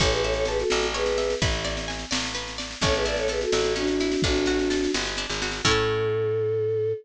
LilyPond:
<<
  \new Staff \with { instrumentName = "Choir Aahs" } { \time 6/8 \key a \major \tempo 4. = 85 <a' cis''>16 <gis' b'>16 <a' cis''>16 <a' cis''>16 <gis' b'>16 <fis' a'>8. <gis' b'>4 | r2. | <a' cis''>16 <gis' b'>16 <b' d''>16 <a' cis''>16 <gis' b'>16 <fis' a'>8. <d' fis'>4 | <d' fis'>4. r4. |
a'2. | }
  \new Staff \with { instrumentName = "Orchestral Harp" } { \time 6/8 \key a \major cis''8 e''8 a''8 e''8 cis''8 e''8 | b'8 d''8 gis''8 d''8 b'8 d''8 | cis'8 e'8 a'8 e'8 cis'8 e'8 | d'8 fis'8 a'8 fis'8 d'8 fis'8 |
<cis' e' a'>2. | }
  \new Staff \with { instrumentName = "Electric Bass (finger)" } { \clef bass \time 6/8 \key a \major a,,4. a,,4. | a,,4. a,,4. | a,,4. a,,4. | a,,4. g,,8. gis,,8. |
a,2. | }
  \new DrumStaff \with { instrumentName = "Drums" } \drummode { \time 6/8 <bd sn>16 sn16 sn16 sn16 sn16 sn16 sn16 sn16 sn16 sn16 sn16 sn16 | <bd sn>16 sn16 sn16 sn16 sn16 sn16 sn16 sn16 sn16 sn16 sn16 sn16 | <bd sn>16 sn16 sn16 sn16 sn16 sn16 sn16 sn16 sn16 sn16 sn16 sn16 | <bd sn>16 sn16 sn16 sn16 sn16 sn16 sn16 sn16 sn16 sn16 sn16 sn16 |
<cymc bd>4. r4. | }
>>